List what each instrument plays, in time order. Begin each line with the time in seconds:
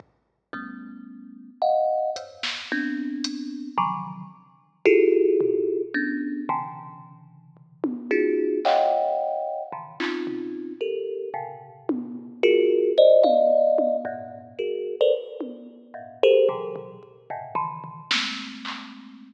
0.00 kick
0.53 kalimba G3 A3 B3 C#4, kick
1.62 kalimba D#5 F5 F#5
2.16 kalimba E2 F2 G2, closed hi-hat
2.43 snare
2.72 kalimba B3 C4 D4
3.24 closed hi-hat
3.78 kalimba C3 D3 D#3 F3 F#3, kick
4.85 kalimba E4 F4 F#4 G4 G#4 A4, kick
5.41 floor tom
5.94 kalimba B3 C#4 D4
6.49 kalimba B2 C3 C#3 D3 E3
7.57 floor tom
7.84 high tom
8.11 kalimba C#4 D#4 F4 F#4 G#4
8.65 kalimba C#5 D#5 F5 F#5 G5, clap
9.72 kalimba A2 B2 C#3 D3 D#3 E3
10.00 kalimba C4 C#4 D#4 F4, clap
10.27 floor tom
10.81 kalimba G4 A4 A#4
11.34 kalimba A2 B2 C3 C#3
11.89 high tom
12.43 kalimba F4 F#4 G#4 A#4
12.98 kalimba C5 D5 D#5
13.23 kalimba D5 D#5 F5, high tom
13.78 high tom
14.05 kalimba F#2 G2 G#2 A#2
14.59 kalimba F#4 G#4 A#4
15.01 kalimba A4 A#4 B4 C5 D5
15.41 high tom
15.94 kalimba G2 G#2 A2 A#2
16.23 kalimba G4 G#4 A4 A#4 C5
16.49 kalimba B2 C3 D3 E3 F#3, floor tom
16.76 floor tom
17.03 kick
17.30 kalimba G2 G#2 A#2 B2 C3 C#3
17.55 kalimba C#3 D#3 E3
17.84 floor tom
18.11 kalimba G#3 A3 A#3 C4, snare
18.65 clap